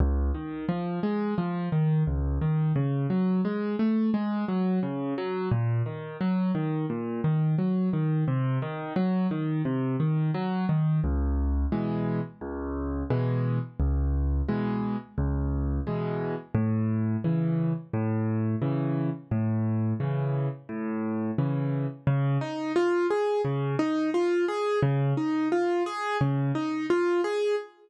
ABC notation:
X:1
M:4/4
L:1/8
Q:1/4=87
K:Db
V:1 name="Acoustic Grand Piano"
D,, E, F, A, F, E, D,, E, | D, G, A, =A, _A, G, D, G, | B,, E, G, E, B,, E, G, E, | C, E, G, E, C, E, G, E, |
[K:C#m] C,,2 [B,,E,G,]2 C,,2 [B,,E,G,]2 | C,,2 [B,,E,G,]2 C,,2 [B,,E,G,]2 | A,,2 [C,E,]2 A,,2 [C,E,]2 | A,,2 [C,E,]2 A,,2 [C,E,]2 |
[K:Db] D, E F A D, E F A | D, E F A D, E F A |]